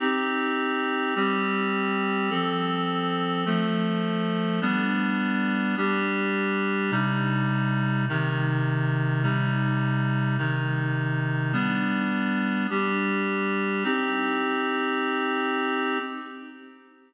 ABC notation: X:1
M:3/4
L:1/8
Q:1/4=78
K:Cm
V:1 name="Clarinet"
[CEG]3 [G,CG]3 | [F,C=A]3 [F,=A,A]3 | [G,=B,D]3 [G,DG]3 | [C,G,E]3 [C,E,E]3 |
[C,G,E]3 [C,E,E]3 | [G,=B,D]3 [G,DG]3 | [CEG]6 |]